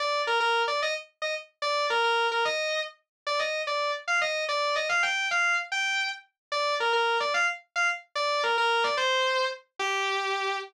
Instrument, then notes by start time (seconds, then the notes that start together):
distortion guitar
0.00 D5
0.27 A#4
0.40 A#4
0.68 D5
0.82 D#5
1.22 D#5
1.62 D5
1.90 A#4
2.04 A#4
2.32 A#4
2.45 D#5
3.27 D5
3.39 D#5
3.67 D5
4.08 F5
4.21 D#5
4.49 D5
4.76 D#5
4.89 F5
5.03 G5
5.31 F5
5.72 G5
6.52 D5
6.80 A#4
6.93 A#4
7.20 D5
7.34 F5
7.76 F5
8.15 D5
8.43 A#4
8.58 A#4
8.84 D5
8.97 C5
9.79 G4